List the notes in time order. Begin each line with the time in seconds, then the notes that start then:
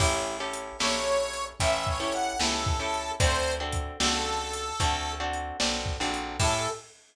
0.00 A1 C#4 E4 G4 A4, kick, crash
0.40 C#4 E4 G4 A4
0.54 closed hi-hat
0.79 A#1 C#4 E4 G4 A4 C#5, snare
1.33 closed hi-hat
1.60 A1 C#4 E4 G4 A4 E5, kick, closed hi-hat
1.87 C#5, kick
2.00 C#4 E4 G4 A4
2.12 F#5, closed hi-hat
2.40 C#2 C#4 E4 G4 A4, snare
2.66 kick
2.80 C#4 E4 G4 A4
2.94 closed hi-hat
3.20 D2 C4 D4 F#4 A4 C5, kick, closed hi-hat
3.60 C4 D4 F#4 A4
3.73 kick, closed hi-hat
4.00 C#2 C4 D4 F#4 A4, snare
4.53 closed hi-hat
4.80 D2 C4 D4 F#4 A4, kick, closed hi-hat
5.20 C4 D4 F#4 A4
5.33 closed hi-hat
5.60 B1 C4 D4 F#4 A4, snare
5.86 kick
6.00 A#1 C4 D4 F#4 A4
6.14 closed hi-hat
6.40 A2 C#4 E4 G4 A4, kick, crash